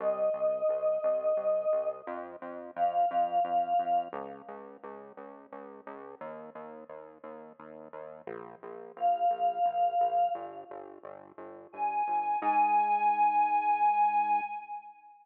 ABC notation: X:1
M:3/4
L:1/8
Q:1/4=87
K:Ab
V:1 name="Choir Aahs"
e6 | z2 f4 | z6 | z6 |
z2 f4 | z4 a2 | a6 |]
V:2 name="Synth Bass 1" clef=bass
C,, C,, C,, C,, C,, C,, | F,, F,, F,, F,, F,, F,, | D,, D,, D,, D,, D,, D,, | E,, E,, E,, E,, E,, E,, |
B,,, B,,, B,,, B,,, B,,, B,,, | G,,, G,,, G,,, G,,, G,,, G,,, | A,,6 |]